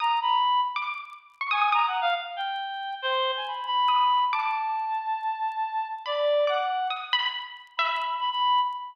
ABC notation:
X:1
M:5/4
L:1/16
Q:1/4=139
K:none
V:1 name="Clarinet"
^a2 b4 z8 ^g2 (3a2 ^f2 =f2 | z2 g6 c3 ^g b2 b6 | a16 d4 | ^f4 z8 b4 b b3 |]
V:2 name="Harpsichord"
^d'6 z =d'5 z ^c' ^d' d' d'4 | z16 ^d' z3 | d'16 b4 | d' z3 ^d'2 b6 e z7 |]